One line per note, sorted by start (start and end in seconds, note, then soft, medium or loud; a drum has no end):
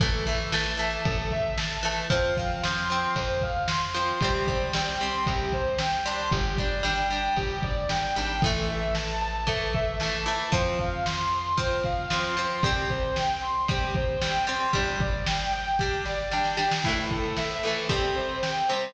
0.00 0.98 A1 medium
0.00 0.25 E3 medium
0.00 0.25 A3 medium
0.00 0.24 A4 medium
0.00 kick loud
0.00 ride medium
0.26 0.51 E3 medium
0.26 0.51 A3 medium
0.26 0.50 E5 medium
0.26 kick medium
0.26 ride medium
0.52 0.76 E3 medium
0.52 0.76 A3 medium
0.52 0.77 A5 medium
0.52 snare loud
0.77 1.74 E3 medium
0.77 1.74 A3 medium
0.77 1.03 A5 medium
0.77 ride medium
1.05 2.02 A1 medium
1.05 1.29 A4 medium
1.05 kick loud
1.05 ride loud
1.31 1.56 E5 medium
1.31 kick medium
1.31 ride medium
1.58 1.82 A5 medium
1.58 snare loud
1.83 2.07 E3 medium
1.83 2.07 A3 medium
1.83 2.08 A5 medium
1.83 ride medium
2.10 3.07 F2 loud
2.10 2.34 F3 loud
2.10 2.34 C4 loud
2.10 2.35 C5 medium
2.10 kick loud
2.10 ride loud
2.37 2.62 F3 medium
2.37 2.62 C4 medium
2.37 2.61 F5 medium
2.37 kick medium
2.37 ride medium
2.63 2.89 F3 medium
2.63 2.89 C4 medium
2.63 2.87 C6 medium
2.63 snare loud
2.89 3.87 F3 medium
2.89 3.87 C4 medium
2.89 3.14 C6 medium
2.89 ride medium
3.16 4.13 F2 loud
3.16 3.40 C5 medium
3.16 kick medium
3.16 ride loud
3.41 3.67 F5 medium
3.41 kick medium
3.41 ride medium
3.68 3.93 C6 medium
3.68 snare loud
3.94 4.19 F3 medium
3.94 4.19 C4 medium
3.94 4.19 C6 medium
3.94 ride medium
4.21 5.18 C2 loud
4.21 4.47 G3 loud
4.21 4.47 C4 loud
4.21 4.45 G4 medium
4.21 kick loud
4.21 ride loud
4.47 4.72 G3 medium
4.47 4.72 C4 medium
4.47 4.71 C5 medium
4.47 kick medium
4.47 ride medium
4.73 4.99 G3 medium
4.73 4.99 C4 medium
4.73 4.98 G5 medium
4.73 snare loud
5.00 5.98 G3 medium
5.00 5.98 C4 medium
5.00 5.24 C6 medium
5.00 ride medium
5.26 6.24 C2 medium
5.26 5.50 G4 medium
5.26 kick medium
5.26 ride loud
5.52 5.77 C5 medium
5.52 kick medium
5.52 ride medium
5.79 6.03 G5 medium
5.79 snare loud
6.05 6.56 G3 medium
6.05 6.56 D4 loud
6.05 6.29 C6 medium
6.05 ride medium
6.31 7.29 G1 loud
6.31 6.56 G4 medium
6.31 kick medium
6.31 ride loud
6.58 6.82 G3 medium
6.58 6.82 D4 medium
6.58 6.82 D5 medium
6.58 kick medium
6.58 ride medium
6.83 7.07 G3 medium
6.83 7.07 D4 medium
6.83 7.09 G5 medium
6.83 snare loud
7.10 8.07 G3 medium
7.10 8.07 D4 medium
7.10 7.35 G5 medium
7.10 ride medium
7.37 7.87 G1 medium
7.37 7.61 G4 medium
7.37 kick medium
7.37 ride loud
7.62 7.87 D5 medium
7.62 kick medium
7.62 ride medium
7.89 8.13 G1 medium
7.89 8.14 G5 medium
7.89 snare loud
8.15 8.41 G#1 medium
8.15 8.40 G3 medium
8.15 8.40 D4 medium
8.15 8.40 G5 medium
8.15 ride medium
8.42 10.37 A1 loud
8.42 9.41 E3 medium
8.42 9.41 A3 loud
8.42 8.66 A4 medium
8.42 kick loud
8.42 ride loud
8.68 8.93 E5 medium
8.68 ride medium
8.95 9.19 A5 medium
8.95 snare loud
9.21 9.45 A5 medium
9.21 ride medium
9.47 9.95 E3 medium
9.47 9.95 A3 medium
9.47 9.71 A4 medium
9.47 kick medium
9.47 ride loud
9.73 9.98 E5 medium
9.73 kick medium
9.73 ride medium
10.00 10.25 E3 medium
10.00 10.25 A3 medium
10.00 10.24 A5 medium
10.00 snare loud
10.26 10.50 E3 medium
10.26 10.50 A3 medium
10.26 10.50 A5 medium
10.26 ride medium
10.52 12.47 F2 loud
10.52 11.49 F3 loud
10.52 11.49 C4 loud
10.52 10.77 C5 medium
10.52 kick loud
10.52 ride loud
10.78 11.03 F5 medium
10.78 kick medium
10.78 ride medium
11.05 11.30 C6 medium
11.05 snare loud
11.32 11.56 C6 medium
11.32 ride medium
11.57 12.06 F3 medium
11.57 12.06 C4 medium
11.57 11.82 C5 medium
11.57 kick medium
11.57 ride loud
11.84 12.09 F5 medium
11.84 kick medium
11.84 ride medium
12.10 12.35 F3 medium
12.10 12.35 C4 medium
12.10 12.35 C6 medium
12.10 snare loud
12.37 12.61 F3 medium
12.37 12.61 C4 medium
12.37 12.61 C6 medium
12.37 ride medium
12.63 14.57 C2 loud
12.63 13.61 G3 loud
12.63 13.61 C4 loud
12.63 12.87 G4 medium
12.63 kick loud
12.63 ride loud
12.89 13.14 C5 medium
12.89 kick medium
12.89 ride medium
13.16 13.40 G5 medium
13.16 snare loud
13.41 13.66 C6 medium
13.41 ride medium
13.68 14.17 G3 medium
13.68 14.17 C4 medium
13.68 13.93 G4 medium
13.68 kick loud
13.68 ride loud
13.94 14.19 C5 medium
13.94 kick loud
13.94 ride medium
14.21 14.46 G3 medium
14.21 14.46 C4 medium
14.21 14.45 G5 medium
14.21 snare loud
14.47 14.71 G3 medium
14.47 14.71 C4 medium
14.47 14.71 C6 medium
14.47 ride medium
14.73 16.69 G1 loud
14.73 15.70 G3 loud
14.73 15.70 D4 loud
14.73 14.98 G4 medium
14.73 kick medium
14.73 ride loud
15.00 15.24 D5 medium
15.00 kick loud
15.00 ride medium
15.26 15.51 G5 medium
15.26 snare loud
15.52 15.77 G5 medium
15.52 ride medium
15.79 16.29 G3 medium
15.79 16.29 D4 medium
15.79 16.03 G4 medium
15.79 kick medium
15.79 snare medium
16.05 16.29 D5 medium
16.05 snare medium
16.31 16.56 G3 medium
16.31 16.56 D4 medium
16.31 16.56 G5 medium
16.31 snare medium
16.44 snare medium
16.57 16.81 G3 medium
16.57 16.81 D4 medium
16.57 16.82 G5 medium
16.57 snare medium
16.71 snare loud
16.84 17.57 A2 medium
16.84 17.57 E3 medium
16.84 17.08 E4 medium
16.84 kick medium
16.84 crash loud
16.88 17.57 A3 medium
16.97 ride medium
17.11 17.35 A4 medium
17.11 kick medium
17.11 ride medium
17.24 ride medium
17.37 17.61 E5 medium
17.37 snare medium
17.50 ride medium
17.63 17.87 A2 medium
17.63 17.87 E3 medium
17.63 17.87 A3 medium
17.63 17.87 A4 medium
17.63 ride medium
17.76 ride medium
17.89 18.62 C3 medium
17.89 18.62 G3 medium
17.89 18.62 C4 medium
17.89 18.14 G4 medium
17.89 kick medium
17.89 ride loud
18.03 ride medium
18.16 18.40 C5 medium
18.16 ride medium
18.29 ride medium
18.42 18.67 G5 medium
18.42 snare medium
18.55 ride medium
18.69 18.94 C3 medium
18.69 18.94 G3 medium
18.69 18.93 C5 medium
18.69 ride medium
18.73 18.94 C4 medium
18.81 ride medium